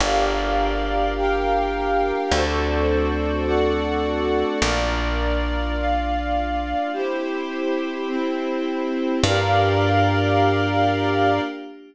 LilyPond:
<<
  \new Staff \with { instrumentName = "Pad 5 (bowed)" } { \time 6/8 \key g \dorian \tempo 4. = 52 <bes d' f' g'>2. | <a c' d' fis'>2. | <bes d' f'>2. | <c' e' g'>2. |
<bes d' f' g'>2. | }
  \new Staff \with { instrumentName = "Pad 5 (bowed)" } { \time 6/8 \key g \dorian <g' bes' d'' f''>4. <g' bes' f'' g''>4. | <fis' a' c'' d''>4. <fis' a' d'' fis''>4. | <f' bes' d''>4. <f' d'' f''>4. | <e' g' c''>4. <c' e' c''>4. |
<g' bes' d'' f''>2. | }
  \new Staff \with { instrumentName = "Electric Bass (finger)" } { \clef bass \time 6/8 \key g \dorian g,,2. | d,2. | bes,,2. | r2. |
g,2. | }
>>